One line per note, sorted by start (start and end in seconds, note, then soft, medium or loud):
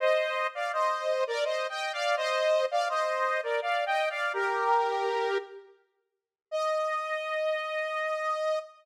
0.00 0.47 C5 medium
0.00 0.47 D#5 loud
0.55 0.72 D5 medium
0.55 0.72 F5 medium
0.73 1.24 C5 medium
0.73 1.24 D#5 medium
1.27 1.44 A#4 medium
1.27 1.44 D5 loud
1.44 1.67 C5 medium
1.44 1.67 D#5 medium
1.69 1.92 D#5 medium
1.69 1.92 G5 medium
1.93 2.16 D5 medium
1.93 2.16 F5 loud
2.17 2.66 C5 medium
2.17 2.66 D#5 loud
2.71 2.88 D5 medium
2.71 2.88 F5 medium
2.89 3.41 C5 medium
2.89 3.41 D#5 loud
3.43 3.60 A#4 medium
3.43 3.60 D5 medium
3.62 3.85 D5 medium
3.62 3.85 F5 medium
3.86 4.09 D#5 medium
3.86 4.09 G5 loud
4.10 4.33 D5 medium
4.10 4.33 F5 medium
4.33 5.38 G4 medium
4.33 5.38 A#4 loud
6.51 8.59 D#5 loud